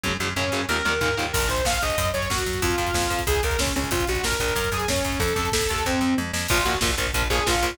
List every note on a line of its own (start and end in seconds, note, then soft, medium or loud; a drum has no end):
0.04 0.17 F#2 medium
0.04 0.11 C#3 loud
0.04 0.11 F#3 loud
0.04 kick medium
0.04 high tom medium
0.19 0.34 F#2 medium
0.19 0.27 C#3 medium
0.19 0.27 F#3 medium
0.19 mid tom medium
0.36 0.50 F#2 medium
0.36 0.43 C#3 medium
0.36 0.43 F#3 medium
0.36 0.64 C#4 medium
0.36 floor tom medium
0.52 0.66 F#2 medium
0.52 0.59 C#3 medium
0.52 0.59 F#3 medium
0.69 0.82 D#2 medium
0.69 0.75 A#2 medium
0.69 0.75 D#3 medium
0.69 1.16 A#4 loud
0.69 high tom medium
0.85 0.99 D#2 medium
0.85 0.92 A#2 medium
0.85 0.92 D#3 medium
0.85 mid tom medium
1.01 1.15 D#2 medium
1.01 1.08 A#2 loud
1.01 1.08 D#3 medium
1.01 floor tom medium
1.17 1.32 D#2 medium
1.17 1.24 A#2 medium
1.17 1.24 D#3 medium
1.33 1.48 A#1 medium
1.33 1.47 A#4 loud
1.33 kick medium
1.33 crash loud
1.41 kick medium
1.41 closed hi-hat medium
1.48 1.62 A#1 medium
1.48 1.64 C5 loud
1.48 kick medium
1.48 closed hi-hat medium
1.57 kick medium
1.57 closed hi-hat medium
1.65 1.79 A#1 medium
1.65 1.81 F5 medium
1.65 kick medium
1.65 snare loud
1.73 kick medium
1.73 closed hi-hat medium
1.82 1.96 A#1 medium
1.82 2.08 D#5 medium
1.82 kick medium
1.82 closed hi-hat medium
1.89 kick medium
1.89 closed hi-hat medium
1.98 2.12 F#2 medium
1.98 kick medium
1.98 closed hi-hat loud
2.05 kick medium
2.05 closed hi-hat medium
2.13 2.28 F#2 medium
2.13 2.29 C#5 medium
2.13 kick medium
2.13 closed hi-hat medium
2.22 kick medium
2.22 closed hi-hat medium
2.30 2.44 F#2 medium
2.30 2.61 F#4 loud
2.30 kick medium
2.30 snare medium
2.38 kick medium
2.38 closed hi-hat medium
2.46 2.60 F#2 medium
2.46 kick medium
2.46 closed hi-hat medium
2.53 kick medium
2.53 closed hi-hat medium
2.62 2.76 F2 medium
2.62 3.20 F4 medium
2.62 kick medium
2.62 closed hi-hat medium
2.70 kick medium
2.70 closed hi-hat medium
2.78 2.92 F2 medium
2.78 kick medium
2.78 closed hi-hat medium
2.87 kick medium
2.87 closed hi-hat medium
2.94 3.08 F2 medium
2.94 kick medium
2.94 snare loud
3.02 kick medium
3.02 closed hi-hat medium
3.10 3.24 F2 medium
3.10 kick medium
3.10 closed hi-hat medium
3.19 kick medium
3.19 closed hi-hat medium
3.27 3.41 C#2 medium
3.27 3.41 G#4 medium
3.27 kick medium
3.27 closed hi-hat loud
3.35 kick medium
3.35 closed hi-hat medium
3.43 3.57 C#2 medium
3.43 3.59 A#4 medium
3.43 kick medium
3.43 closed hi-hat medium
3.50 kick medium
3.50 closed hi-hat medium
3.59 3.72 C#2 medium
3.59 3.74 C#4 medium
3.59 kick medium
3.59 snare loud
3.67 kick medium
3.67 closed hi-hat medium
3.76 3.90 C#2 medium
3.76 3.91 C#4 loud
3.76 kick medium
3.76 closed hi-hat medium
3.84 kick medium
3.84 closed hi-hat medium
3.91 4.05 A#1 medium
3.91 4.05 F4 loud
3.91 kick medium
3.91 closed hi-hat medium
4.00 kick medium
4.00 closed hi-hat medium
4.07 4.22 A#1 medium
4.07 4.23 F#4 medium
4.07 kick medium
4.07 closed hi-hat medium
4.15 kick medium
4.15 closed hi-hat medium
4.23 4.37 A#1 medium
4.23 4.39 A#4 medium
4.23 kick medium
4.23 snare loud
4.32 kick medium
4.32 closed hi-hat medium
4.40 4.54 A#1 medium
4.40 4.70 A#4 medium
4.40 kick medium
4.40 closed hi-hat medium
4.48 kick medium
4.48 closed hi-hat medium
4.55 4.69 F#2 medium
4.55 kick medium
4.55 closed hi-hat medium
4.64 kick medium
4.64 closed hi-hat medium
4.72 4.85 F#2 medium
4.72 4.86 G#4 loud
4.72 kick medium
4.72 closed hi-hat medium
4.80 kick medium
4.80 closed hi-hat medium
4.88 5.02 F#2 medium
4.88 5.19 C#4 loud
4.88 kick medium
4.88 snare medium
4.96 kick medium
4.96 closed hi-hat medium
5.05 5.18 F#2 medium
5.05 kick medium
5.05 closed hi-hat medium
5.12 kick medium
5.12 closed hi-hat medium
5.19 5.34 F2 medium
5.19 5.49 A4 loud
5.19 kick medium
5.19 closed hi-hat medium
5.28 kick medium
5.28 closed hi-hat medium
5.36 5.50 F2 medium
5.36 kick medium
5.36 closed hi-hat medium
5.44 kick medium
5.44 closed hi-hat medium
5.52 5.67 F2 medium
5.52 5.83 A4 loud
5.52 kick medium
5.52 snare loud
5.61 kick medium
5.61 closed hi-hat medium
5.69 5.84 D#2 medium
5.69 kick medium
5.69 closed hi-hat medium
5.76 kick medium
5.76 closed hi-hat medium
5.85 6.00 F2 medium
5.85 6.14 C4 medium
5.85 kick medium
5.85 floor tom medium
6.01 6.15 F2 medium
6.01 mid tom medium
6.18 6.32 F2 medium
6.18 high tom medium
6.33 6.47 F2 medium
6.33 snare medium
6.49 6.64 A#1 medium
6.49 6.56 F3 loud
6.49 6.56 A#3 loud
6.49 6.66 F4 loud
6.49 kick loud
6.49 crash loud
6.58 kick medium
6.64 6.79 A#1 medium
6.64 6.72 F3 medium
6.64 6.72 A#3 medium
6.64 6.78 F#4 loud
6.64 kick medium
6.64 closed hi-hat medium
6.74 kick medium
6.81 6.95 A#1 medium
6.81 6.88 F3 medium
6.81 6.88 A#3 medium
6.81 kick medium
6.81 snare loud
6.89 kick medium
6.98 7.11 A#1 medium
6.98 7.05 F3 medium
6.98 7.05 A#3 loud
6.98 kick medium
6.98 closed hi-hat medium
7.07 kick medium
7.14 7.28 A#1 medium
7.14 7.21 F3 loud
7.14 7.21 A#3 loud
7.14 kick medium
7.14 closed hi-hat loud
7.22 kick medium
7.30 7.44 A#1 medium
7.30 7.37 F3 medium
7.30 7.37 A#3 loud
7.30 7.46 G#4 loud
7.30 kick medium
7.30 closed hi-hat medium
7.38 kick medium
7.46 7.61 A#1 medium
7.46 7.53 F3 medium
7.46 7.53 A#3 medium
7.46 7.76 F4 loud
7.46 kick medium
7.46 snare loud
7.55 kick medium
7.63 7.76 A#1 medium
7.63 7.69 F3 medium
7.63 7.69 A#3 loud
7.63 kick medium
7.63 closed hi-hat medium
7.71 kick medium